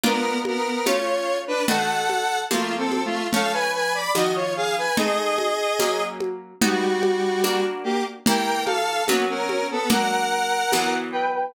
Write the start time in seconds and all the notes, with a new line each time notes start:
0.04 A#3 B3 D4 F4 A#4, low conga
0.45 B3 A#4, high conga
0.86 A3 C#4 F4 C#5, tambourine, high conga
1.47 D4 B4
1.68 D#3 A3 F#4 A4 F#5, low conga
2.10 high conga
2.51 F3 A3 A#3 C4 F4, tambourine, high conga
2.78 C4 A4
2.92 high conga
3.05 A3 F4
3.33 F3 A3 C#4 A4 F5, low conga
3.53 B4 G#5
3.74 B4 G#5
3.94 D5 B5
4.15 D#3 F3 A#3 F#4 D#5, tambourine, high conga
4.35 F4 C#5
4.57 G#4 F5
4.78 B4 G#5
4.97 A3 C4 D#4 G#4 D#5, low conga
5.38 high conga
5.79 F#3 A#3 C#4, tambourine, high conga
6.20 high conga
6.62 G3 B3 D#4 F#4, low conga
7.03 high conga
7.44 A#3 D4 F#4, tambourine, high conga
7.84 A#3 G4
8.26 E3 A#3 G4 A#4 G5, low conga
8.65 A4 F5, high conga
9.07 F#3 A#3 B3 C#4 F#4, tambourine, high conga
9.29 C#4 A#4
9.49 high conga
9.71 B3 A4
9.90 F#3 A#3 D4 A#4 F#5, low conga
10.72 E3 F#3 B3, tambourine, high conga
11.12 B4 G5
11.34 B4 G5